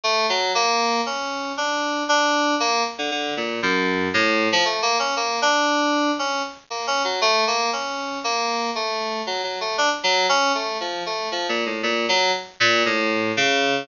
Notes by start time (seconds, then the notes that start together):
0.04 A3
0.29 F#3
0.55 A#3
1.06 C#4
1.57 D4
2.09 D4
2.60 A#3
2.98 D3
3.11 D3
3.37 A#2
3.63 F#2
4.14 A2
4.52 F3
4.65 A3
4.82 A#3
4.99 C#4
5.16 A#3
5.42 D4
6.19 C#4
6.70 A#3
6.87 C#4
7.04 F#3
7.21 A3
7.47 A#3
7.73 C#4
8.24 A#3
8.75 A3
9.27 F#3
9.44 F#3
9.61 A3
9.78 D4
10.03 F#3
10.29 C#4
10.55 A3
10.80 F3
11.06 A3
11.32 F3
11.49 A#2
11.66 A2
11.83 A#2
12.09 F#3
12.60 A#2
12.86 A2
13.37 C#3